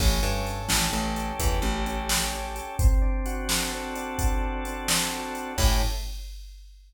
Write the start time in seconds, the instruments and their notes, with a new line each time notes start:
0.00 electric bass (finger) A1, drawbar organ C#4, kick, crash
0.23 electric bass (finger) G2, drawbar organ A4
0.47 drawbar organ C#4, closed hi-hat
0.69 electric bass (finger) A1, drawbar organ G4, snare
0.93 electric bass (finger) A1, drawbar organ C#4
1.16 drawbar organ A4, closed hi-hat
1.39 electric bass (finger) E2, drawbar organ G4, kick, closed hi-hat
1.62 electric bass (finger) A1, drawbar organ C#4
1.86 drawbar organ C#4, closed hi-hat
2.09 drawbar organ A4, snare
2.33 drawbar organ C#4
2.55 drawbar organ G4, closed hi-hat
2.79 drawbar organ C4, kick, closed hi-hat
3.02 drawbar organ D4
3.26 drawbar organ F#4, closed hi-hat
3.49 drawbar organ A4, snare
3.72 drawbar organ C4
3.95 drawbar organ D4, closed hi-hat
4.18 drawbar organ F#4, kick, closed hi-hat
4.42 drawbar organ A4
4.65 drawbar organ C4, closed hi-hat
4.88 drawbar organ D4, snare
5.12 drawbar organ F#4
5.35 drawbar organ A4, closed hi-hat
5.58 electric bass (finger) A2, drawbar organ C#4 E4 G4 A4, kick, crash